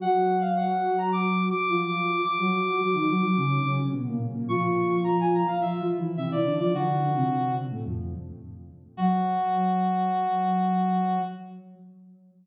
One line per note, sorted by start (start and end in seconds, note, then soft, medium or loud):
0.00 1.50 F#3 loud
0.00 1.50 F#4 loud
0.00 0.39 F#5 loud
0.41 0.54 F5 medium
0.57 0.96 F#5 medium
0.98 1.11 A#5 medium
1.12 1.44 D6 medium
1.48 1.80 D6 medium
1.68 2.22 F3 medium
1.68 2.22 F4 medium
1.87 2.22 D6 medium
2.24 3.71 D6 medium
2.38 2.79 F#3 medium
2.38 2.79 F#4 loud
2.80 2.94 F#3 medium
2.80 2.94 F#4 medium
2.94 3.07 D#3 medium
2.94 3.07 D#4 loud
3.09 3.22 F#3 medium
3.09 3.22 F#4 loud
3.23 3.36 F#3 loud
3.23 3.36 F#4 loud
3.36 3.59 C#3 medium
3.36 3.59 C#4 medium
3.64 3.89 C#3 medium
3.64 3.89 C#4 loud
3.92 4.06 B2 medium
3.92 4.06 B3 medium
4.07 4.20 A#2 medium
4.07 4.20 A#3 loud
4.34 4.48 A#2 medium
4.34 4.48 A#3 medium
4.49 5.42 F3 loud
4.49 5.42 F4 loud
4.49 4.96 C#6 medium
5.04 5.17 A#5 medium
5.20 5.33 G#5 medium
5.34 5.48 A#5 medium
5.47 5.61 F5 medium
5.61 5.79 F3 medium
5.61 5.79 F4 medium
5.61 5.88 E5 medium
5.79 5.97 F3 medium
5.79 5.97 F4 loud
5.98 6.16 E3 medium
5.98 6.16 E4 loud
6.17 6.30 C3 medium
6.17 6.30 C4 medium
6.17 6.30 E5 medium
6.31 6.44 E3 medium
6.31 6.44 E4 loud
6.31 6.54 D5 medium
6.45 6.58 D3 medium
6.45 6.58 D4 loud
6.59 6.72 F3 medium
6.59 6.72 F4 loud
6.59 6.72 D5 medium
6.73 6.99 D3 medium
6.73 6.99 D4 loud
6.73 7.52 F#4 medium
7.01 7.14 D3 medium
7.01 7.14 D4 loud
7.15 7.62 C3 medium
7.15 7.62 C4 medium
7.71 7.84 A2 medium
7.71 7.84 A3 loud
7.86 8.13 F2 medium
7.86 8.13 F3 loud
8.97 11.19 F#3 loud
8.97 11.19 F#4 loud